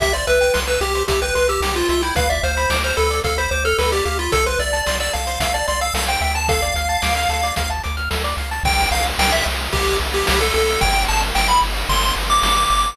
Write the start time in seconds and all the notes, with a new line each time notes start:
0.00 C2 G4 E5, kick, closed hi-hat
0.13 C5 D5, closed hi-hat
0.27 C2 B4 E5, closed hi-hat
0.41 G5, closed hi-hat
0.54 C2 C6, snare
0.67 B4 E6, closed hi-hat
0.81 C2 G4, closed hi-hat
0.95 C5, closed hi-hat
1.08 C2 G4 E5, kick, closed hi-hat
1.22 B4 G5, closed hi-hat
1.35 C2 B4 C6, closed hi-hat
1.48 G4 E6, closed hi-hat
1.60 C2 G4, snare
1.75 F4 C5, closed hi-hat
1.89 C2 F4 E5, closed hi-hat
2.02 E4 G5, closed hi-hat
2.16 D2 B4 F5, kick, closed hi-hat
2.29 D5 E5, closed hi-hat
2.43 D2 C5 F5, closed hi-hat
2.57 B5, closed hi-hat
2.70 D2 D6, snare
2.84 C5 F6, closed hi-hat
2.97 D2 A4 B4, closed hi-hat
3.10 D5, closed hi-hat
3.24 D2 A4 F5, kick, closed hi-hat
3.38 C5 B5, closed hi-hat
3.51 D2 C5 D6, closed hi-hat
3.65 A4 F6, closed hi-hat
3.78 D2 A4 B4, snare
3.92 G4 D5, closed hi-hat
4.05 D2 G4 F5, closed hi-hat
4.19 F4 B5, closed hi-hat
4.32 C2 A4, kick, closed hi-hat
4.46 B4 C5, closed hi-hat
4.59 C2 D5 E5, closed hi-hat
4.73 A5, closed hi-hat
4.86 C2 C6, snare
5.00 D5 E6, closed hi-hat
5.13 C2 A4 F5, closed hi-hat
5.27 C5, closed hi-hat
5.40 C2 E5 F5, kick, closed hi-hat
5.54 D5 A5, closed hi-hat
5.67 C2 D5 C6, closed hi-hat
5.81 F5 E6, closed hi-hat
5.94 C2 A4 F5, snare
6.08 C5 G5, closed hi-hat
6.21 D2 E5 G5, closed hi-hat
6.35 A5, closed hi-hat
6.48 A4 F5, kick, closed hi-hat
6.62 D5, closed hi-hat
6.74 D2 F5, closed hi-hat
6.89 A5, closed hi-hat
7.02 D2 D6, snare
7.16 F6, closed hi-hat
7.29 D2 A4, closed hi-hat
7.43 D5, closed hi-hat
7.56 D2 F5, kick, closed hi-hat
7.70 A5, closed hi-hat
7.83 D2 D6, closed hi-hat
7.97 F6, closed hi-hat
8.11 D2 A4, snare
8.24 D5, closed hi-hat
8.37 C#2 F5, closed hi-hat
8.51 A5, closed hi-hat
8.63 C2 G5, kick, crash
8.78 ride
8.91 C2 F5, ride
9.05 ride
9.19 C2 G5, snare
9.32 E5, ride
9.46 C2, ride
9.59 ride
9.72 C2 G4, kick, ride
9.87 ride
10.00 C2, ride
10.13 G4, ride
10.27 C2 G4, snare
10.40 A4, ride
10.54 C2 A4, ride
10.67 ride
10.81 G1 G5, kick, ride
10.94 ride
11.08 G1 A5, ride
11.22 ride
11.35 G1 G5, snare
11.48 B5, ride
11.62 G1, ride
11.76 ride
11.89 G1 C6, kick, ride
12.03 ride
12.16 G1, ride
12.30 D6, ride
12.43 G1 D6, snare
12.57 D6, ride
12.70 G1 D6, ride
12.84 ride